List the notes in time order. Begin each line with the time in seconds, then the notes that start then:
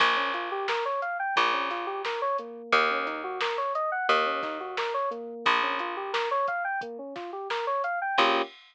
0.00 A#1 A#3, kick, crash
0.16 C#4
0.34 F4, closed hi-hat
0.52 G4
0.68 A#4, snare, closed hi-hat
0.85 C#5
1.02 F5, closed hi-hat
1.19 G5
1.36 A#1 A#3, kick, closed hi-hat
1.53 C#4
1.70 F4, snare, closed hi-hat
1.87 G4
2.05 A#4, snare
2.22 C#5
2.38 A#3, closed hi-hat
2.72 D#2, kick, closed hi-hat
2.90 C#4
3.06 D#4, snare, closed hi-hat
3.24 F#4
3.41 A#4, snare
3.58 C#5
3.75 D#5, closed hi-hat
3.92 F#5
4.09 D#2 A#3, kick, closed hi-hat
4.26 C#4
4.43 D#4, kick, snare, closed hi-hat
4.60 F#4
4.77 A#4, snare
4.94 C#5
5.11 A#3, closed hi-hat
5.46 A#1, kick, closed hi-hat
5.63 C#4
5.79 F4, closed hi-hat
5.97 G4
6.13 A#4, snare
6.31 C#5
6.48 F5, kick, closed hi-hat
6.64 G5
6.81 A#3, kick, closed hi-hat
6.99 C#4
7.15 F4, kick, snare, closed hi-hat
7.33 G4
7.50 A#4, snare
7.67 C#5
7.84 F5, closed hi-hat
8.02 G5
8.18 A#1 A#3 C#4 F4 G4, kick, crash